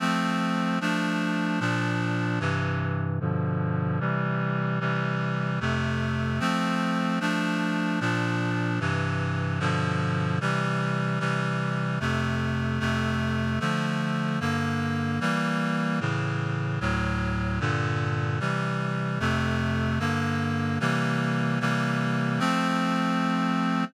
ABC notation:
X:1
M:2/2
L:1/8
Q:1/2=75
K:F
V:1 name="Clarinet"
[F,A,C]4 [F,A,D]4 | [B,,F,D]4 [G,,C,E,]4 | [G,,=B,,D,F,]4 [C,E,G,]4 | [C,E,G,]4 [F,,C,A,]4 |
[F,A,C]4 [F,A,D]4 | [B,,F,D]4 [G,,C,E,]4 | [G,,=B,,D,F,]4 [C,E,G,]4 | [C,E,G,]4 [F,,C,A,]4 |
[F,,C,A,]4 [D,F,A,]4 | [G,,D,B,]4 [E,G,B,]4 | [A,,^C,E,]4 [D,,A,,^F,]4 | [G,,B,,D,]4 [C,E,G,]4 |
[F,,C,A,]4 [G,,D,B,]4 | [C,E,G,B,]4 [C,E,G,B,]4 | [F,A,C]8 |]